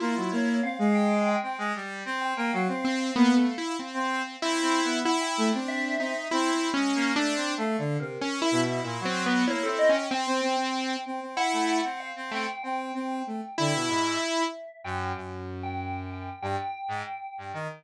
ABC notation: X:1
M:4/4
L:1/16
Q:1/4=95
K:none
V:1 name="Lead 2 (sawtooth)"
E4 z12 | z2 C2 (3B,2 A,2 E2 C4 E4 | E3 D3 ^D2 (3E4 ^C4 =D4 | z4 (3^C2 E2 E2 (3E2 =C2 B,2 (3E2 E2 ^C2 |
C6 z2 E3 z3 A, z | z6 E6 z4 | z16 |]
V:2 name="Electric Piano 2"
F2 ^c2 f2 g2 g2 z4 g g | f16 | ^f g3 e4 z8 | (3f4 ^A4 e4 z4 ^c =A ^d g |
g8 ^f4 =f2 g2 | g8 e6 g2 | z3 g3 g2 g8 |]
V:3 name="Lead 1 (square)"
^A, ^F, A,2 C ^G,4 C G, =G,2 C2 A, | ^F, C3 ^A, B, z3 C2 z (3C2 C2 B,2 | z2 A, C3 C z (3C2 C2 ^G,2 (3^A,2 =A,2 C2 | (3A,2 D,2 C,2 z2 B,,2 ^A,, ^F,3 ^A, C C z |
z C C z3 C C z A,2 C2 C C z | C2 C2 A, z D, B,, ^G,,2 z4 ^F,,2 | ^F,,8 G,, z2 ^G,, z2 =G,, ^D, |]